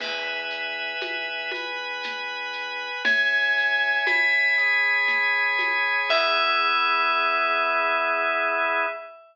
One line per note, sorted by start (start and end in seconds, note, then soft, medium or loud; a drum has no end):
0.00 0.93 E2 loud
0.00 1.51 B4 medium
0.00 1.52 E5 medium
0.00 1.51 G#5 medium
0.00 crash loud
0.00 low conga medium
0.00 shaker medium
0.50 shaker medium
1.01 2.89 E2 medium
1.01 high conga medium
1.01 shaker medium
1.51 3.03 B4 medium
1.51 3.03 G#5 medium
1.51 3.03 B5 medium
1.51 high conga medium
1.51 shaker medium
2.03 low conga medium
2.03 shaker medium
2.53 shaker medium
3.05 3.99 C#2 loud
3.05 4.56 C#5 medium
3.05 4.56 E5 medium
3.05 3.99 G#5 medium
3.05 4.56 G#5 medium
3.05 low conga loud
3.05 shaker medium
3.57 shaker medium
4.06 5.94 C#2 loud
4.06 6.01 B5 medium
4.06 high conga medium
4.06 shaker medium
4.58 6.09 G#4 medium
4.58 6.09 C#5 medium
4.58 6.09 G#5 medium
4.58 shaker medium
5.08 low conga medium
5.08 shaker medium
5.59 high conga medium
5.59 shaker medium
6.09 8.85 E2 loud
6.09 8.86 B3 loud
6.09 8.86 E4 loud
6.09 8.86 G#4 loud
6.09 8.85 E5 loud
6.09 kick loud
6.09 crash loud